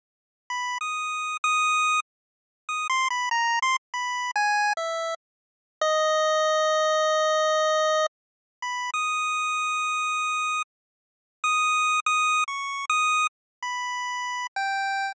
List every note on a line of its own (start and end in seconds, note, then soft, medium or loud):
0.50 0.78 B5 medium
0.81 1.37 D#6 medium
1.44 2.00 D#6 loud
2.69 2.87 D#6 medium
2.89 3.08 C6 medium
3.10 3.29 B5 medium
3.31 3.59 A#5 medium
3.62 3.76 C6 loud
3.94 4.31 B5 medium
4.36 4.73 G#5 medium
4.77 5.14 E5 medium
5.81 8.06 D#5 loud
8.62 8.90 B5 medium
8.94 10.62 D#6 medium
11.44 12.00 D#6 medium
12.06 12.44 D#6 loud
12.48 12.85 C#6 medium
12.89 13.27 D#6 loud
13.62 14.47 B5 medium
14.56 15.12 G5 medium